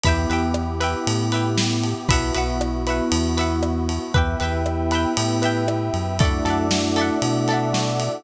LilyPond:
<<
  \new Staff \with { instrumentName = "Electric Piano 1" } { \time 4/4 \key e \minor \tempo 4 = 117 <b e' g'>1 | <b e' fis'>1 | <b e' g'>4 <b e' g'>4 <b e' g'>4 <b e' g'>4 | <a d' e' fis'>4 <a d' e' fis'>4 <a d' e' fis'>4 <a d' e' fis'>4 | }
  \new Staff \with { instrumentName = "Pizzicato Strings" } { \time 4/4 \key e \minor <b' e'' g''>8 <b' e'' g''>4 <b' e'' g''>4 <b' e'' g''>4. | <b' e'' fis''>8 <b' e'' fis''>4 <b' e'' fis''>4 <b' e'' fis''>4. | <b' e'' g''>8 <b' e'' g''>4 <b' e'' g''>4 <b' e'' g''>4. | <a' d'' e'' fis''>8 <a' d'' e'' fis''>4 <a' d'' e'' fis''>4 <a' d'' e'' fis''>4. | }
  \new Staff \with { instrumentName = "Synth Bass 1" } { \clef bass \time 4/4 \key e \minor e,8 e,4. a,2 | b,,8 b,,4. e,2 | e,8 e,4. a,4. fis,8~ | fis,8 fis,4. b,2 | }
  \new Staff \with { instrumentName = "Pad 2 (warm)" } { \time 4/4 \key e \minor <b e' g'>1 | <b e' fis'>1 | <b' e'' g''>1 | <a' d'' e'' fis''>1 | }
  \new DrumStaff \with { instrumentName = "Drums" } \drummode { \time 4/4 <bd cymr>8 cymr8 ss8 cymr8 cymr8 cymr8 sn8 cymr8 | <bd cymr>8 cymr8 ss8 cymr8 cymr8 cymr8 ss8 cymr8 | <bd cymr>8 cymr8 ss8 cymr8 cymr8 cymr8 ss8 cymr8 | <bd cymr>8 cymr8 sn8 cymr8 cymr8 cymr8 sn8 cymr8 | }
>>